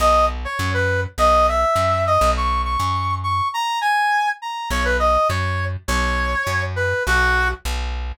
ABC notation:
X:1
M:4/4
L:1/8
Q:1/4=204
K:B
V:1 name="Brass Section"
d2 z c2 B2 z | d2 e4 d2 | c'2 c'4 c'2 | a2 g4 a2 |
c B d2 c3 z | c6 B2 | F3 z5 |]
V:2 name="Electric Bass (finger)" clef=bass
B,,,4 F,,4 | B,,,4 F,,3 B,,,- | B,,,3 F,,5 | z8 |
B,,,4 F,,4 | B,,,4 F,,4 | B,,,4 B,,,4 |]